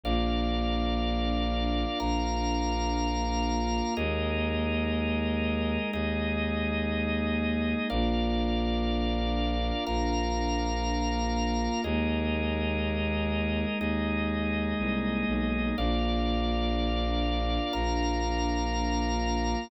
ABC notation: X:1
M:4/4
L:1/8
Q:1/4=61
K:Bbmix
V:1 name="Pad 5 (bowed)"
[B,DF]8 | [A,B,E]8 | [B,DF]8 | [A,B,E]8 |
[B,DF]8 |]
V:2 name="Drawbar Organ"
[Bdf]4 [Bfb]4 | [ABe]4 [EAe]4 | [Bdf]4 [Bfb]4 | [ABe]4 [EAe]4 |
[Bdf]4 [Bfb]4 |]
V:3 name="Violin" clef=bass
B,,,4 B,,,4 | E,,4 E,,4 | B,,,4 B,,,4 | E,,4 E,,2 C,, =B,,, |
B,,,4 B,,,4 |]